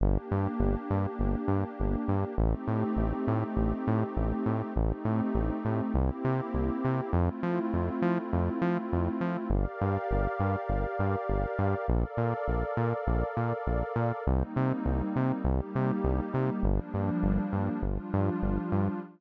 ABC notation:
X:1
M:4/4
L:1/8
Q:1/4=101
K:Gm
V:1 name="Pad 2 (warm)"
[B,DG]8 | [A,CEG]8 | [A,CEG]4 [B,C=EG]4 | [A,C=EF]8 |
[GBdf]8 | [ABdf]8 | [G,B,CE]4 [G,B,EG]4 | [F,G,B,D]4 [F,G,DF]4 |]
V:2 name="Synth Bass 1" clef=bass
G,,, G,, G,,, G,, G,,, G,, G,,, G,, | A,,, A,, A,,, A,, A,,, A,, A,,, A,, | A,,, A,, A,,, A,, C,, C, C,, C, | F,, F, F,, F, F,, F, F,, F, |
G,,, G,, G,,, G,, G,,, G,, G,,, G,, | B,,, B,, B,,, B,, B,,, B,, B,,, B,, | C,, C, C,, C, C,, C, C,, C, | G,,, G,, G,,, G,, G,,, G,, G,,, G,, |]